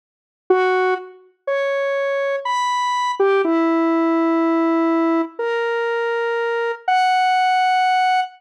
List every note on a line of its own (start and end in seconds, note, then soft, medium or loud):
0.50 0.94 F#4 loud
1.47 2.36 C#5 medium
2.45 3.11 B5 medium
3.19 3.42 G4 loud
3.44 5.22 E4 loud
5.39 6.72 A#4 medium
6.88 8.20 F#5 medium